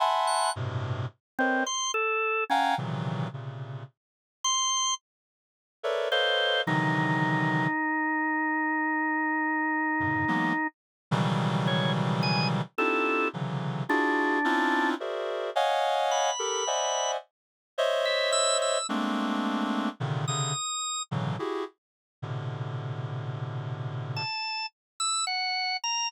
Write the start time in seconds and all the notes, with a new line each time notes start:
0.00 E5 F#5 G#5 A5 B5 C6
0.27 F#6
0.56 G2 A2 B2 C3
1.39 C4 A#4 B4 C5 C#5 D#5
1.66 C6
1.94 A4
2.50 C#4 F5 F#5 G5 G#5 A#5
2.78 A#2 C3 C#3 D#3 E3 F#3
3.33 A#2 C3 C#3
4.44 C6
5.83 A4 A#4 B4 C#5 D5 E5
6.11 A4 B4 C5 C#5 D#5 F5
6.67 C3 D3 D#3 E3 F#3 D#4
10.00 F#2 G2 A2 B2 C#3 D3
10.28 E3 F#3 G#3 A#3 B3
11.11 B2 C#3 D#3 E3 F#3 G3
11.67 C#5
12.23 G#5
12.78 C4 D4 D#4 E4 F4 G4 A4
13.33 C3 C#3 D3 E3 F#3
13.89 D4 E4 F4 F#4 G#4
14.44 C4 C#4 D4 D#4 E4 F4
15.00 F#4 G#4 A#4 C5 D5 E5
15.56 C#5 D#5 F5 F#5 G#5
16.11 B5
16.39 G4 A4 A#4
16.67 C5 D5 D#5 E5 F#5 G#5
17.78 C5 C#5 D#5 E5
18.05 E5
18.32 E6
18.62 E6
18.89 G#3 A3 A#3 C4 D4
20.00 A#2 C3 C#3 D3 D#3
20.28 C3 C#3 D3 D#6
21.11 A2 B2 C#3 D3 E3 F#3
21.39 E4 F#4 G4 G#4
22.22 A2 B2 C3 D3
24.16 A5
25.00 E6
25.27 F#5
25.84 A#5